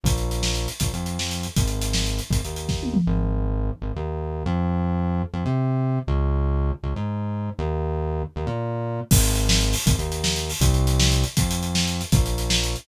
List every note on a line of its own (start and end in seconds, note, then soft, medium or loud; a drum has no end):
0.04 0.68 A#1 loud
0.04 kick loud
0.04 closed hi-hat loud
0.18 closed hi-hat medium
0.31 closed hi-hat medium
0.43 snare loud
0.55 closed hi-hat medium
0.68 closed hi-hat medium
0.80 0.92 A#1 medium
0.80 kick loud
0.80 closed hi-hat loud
0.93 1.47 F2 medium
0.93 closed hi-hat medium
1.06 closed hi-hat medium
1.19 snare loud
1.31 closed hi-hat medium
1.43 closed hi-hat medium
1.56 2.21 G#1 medium
1.56 kick loud
1.56 closed hi-hat loud
1.68 closed hi-hat medium
1.82 closed hi-hat loud
1.93 snare loud
2.06 closed hi-hat medium
2.19 closed hi-hat medium
2.30 2.41 G#1 medium
2.30 kick loud
2.30 closed hi-hat loud
2.44 2.98 D#2 medium
2.44 closed hi-hat medium
2.56 closed hi-hat medium
2.69 kick medium
2.69 snare medium
2.83 high tom medium
2.94 mid tom loud
3.07 3.71 G#1 loud
3.82 3.92 G#1 medium
3.96 4.44 D#2 medium
4.46 5.23 F2 loud
5.33 5.44 F2 loud
5.46 5.99 C3 medium
6.07 6.72 C#2 loud
6.83 6.94 C#2 medium
6.96 7.50 G#2 medium
7.59 8.23 D#2 loud
8.36 8.47 D#2 loud
8.47 9.00 A#2 loud
9.11 9.75 G#1 loud
9.11 kick loud
9.11 crash loud
9.24 closed hi-hat medium
9.35 closed hi-hat medium
9.49 snare loud
9.61 closed hi-hat medium
9.73 open hi-hat loud
9.86 9.97 G#1 loud
9.86 kick loud
9.86 closed hi-hat loud
9.98 10.51 D#2 medium
9.98 closed hi-hat medium
10.12 closed hi-hat medium
10.24 snare loud
10.36 closed hi-hat medium
10.50 open hi-hat loud
10.60 11.24 C2 loud
10.60 kick loud
10.60 closed hi-hat loud
10.74 closed hi-hat medium
10.87 closed hi-hat loud
11.00 snare loud
11.12 closed hi-hat medium
11.24 closed hi-hat medium
11.37 12.02 F2 medium
11.37 kick loud
11.37 closed hi-hat loud
11.51 closed hi-hat loud
11.63 closed hi-hat medium
11.75 snare loud
11.87 closed hi-hat medium
12.01 closed hi-hat medium
12.12 12.76 A#1 loud
12.12 kick loud
12.12 closed hi-hat loud
12.26 closed hi-hat medium
12.38 closed hi-hat medium
12.50 snare loud
12.64 closed hi-hat medium
12.76 closed hi-hat medium